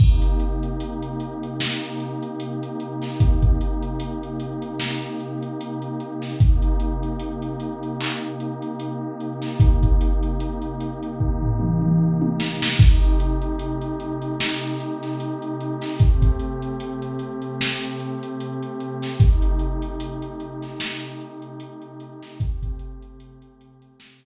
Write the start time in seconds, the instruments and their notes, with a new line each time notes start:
0.00 pad 2 (warm) C3 A#3 D#4 G4, kick, crash
0.22 closed hi-hat
0.40 closed hi-hat
0.63 closed hi-hat
0.80 closed hi-hat
1.02 closed hi-hat
1.20 closed hi-hat
1.43 closed hi-hat
1.60 snare
1.83 closed hi-hat
2.00 closed hi-hat
2.23 closed hi-hat
2.40 closed hi-hat
2.63 closed hi-hat
2.80 closed hi-hat
3.02 snare, closed hi-hat
3.20 kick, closed hi-hat
3.42 kick, closed hi-hat
3.61 closed hi-hat
3.83 closed hi-hat
4.00 closed hi-hat
4.23 closed hi-hat
4.40 closed hi-hat
4.62 closed hi-hat
4.80 snare
5.02 closed hi-hat
5.20 closed hi-hat
5.43 closed hi-hat
5.61 closed hi-hat
5.82 closed hi-hat
6.00 closed hi-hat
6.22 snare, closed hi-hat
6.40 pad 2 (warm) C3 A#3 D#4 G4, kick, closed hi-hat
6.62 closed hi-hat
6.80 closed hi-hat
7.03 closed hi-hat
7.20 closed hi-hat
7.42 closed hi-hat
7.60 closed hi-hat
7.83 closed hi-hat
8.01 clap
8.23 closed hi-hat
8.40 closed hi-hat
8.62 closed hi-hat
8.80 closed hi-hat
9.20 closed hi-hat
9.42 snare, closed hi-hat
9.60 kick, closed hi-hat
9.83 kick, closed hi-hat
10.01 closed hi-hat
10.23 closed hi-hat
10.40 closed hi-hat
10.62 closed hi-hat
10.81 closed hi-hat
11.03 closed hi-hat
11.20 kick
11.42 floor tom
11.60 mid tom
11.82 mid tom
12.22 high tom
12.40 snare
12.62 snare
12.79 pad 2 (warm) C3 A3 D#4 G4, kick, crash
13.02 closed hi-hat
13.20 closed hi-hat
13.42 closed hi-hat
13.59 closed hi-hat
13.82 closed hi-hat
14.00 closed hi-hat
14.22 closed hi-hat
14.40 snare
14.63 closed hi-hat
14.80 closed hi-hat
15.03 snare, closed hi-hat
15.20 closed hi-hat
15.42 closed hi-hat
15.61 closed hi-hat
15.82 snare, closed hi-hat
16.00 pad 2 (warm) C3 A3 C4 G4, kick, closed hi-hat
16.22 kick, closed hi-hat
16.39 closed hi-hat
16.62 closed hi-hat
16.80 closed hi-hat
17.02 closed hi-hat
17.19 closed hi-hat
17.42 closed hi-hat
17.61 snare
17.82 closed hi-hat
18.00 closed hi-hat
18.23 closed hi-hat
18.41 closed hi-hat
18.63 closed hi-hat
18.80 closed hi-hat
19.02 snare, closed hi-hat
19.20 pad 2 (warm) C3 A3 D#4 G4, kick, closed hi-hat
19.42 closed hi-hat
19.59 closed hi-hat
19.82 closed hi-hat
20.00 closed hi-hat
20.22 closed hi-hat
20.40 closed hi-hat
20.62 snare, closed hi-hat
20.80 snare
21.03 closed hi-hat
21.21 closed hi-hat
21.42 closed hi-hat
21.60 closed hi-hat
21.82 closed hi-hat
22.00 closed hi-hat
22.23 snare, closed hi-hat
22.40 pad 2 (warm) C3 A3 C4 G4, kick, closed hi-hat
22.62 kick, closed hi-hat
22.79 closed hi-hat
23.02 closed hi-hat
23.20 closed hi-hat
23.42 closed hi-hat
23.61 closed hi-hat
23.82 closed hi-hat
24.00 snare
24.23 closed hi-hat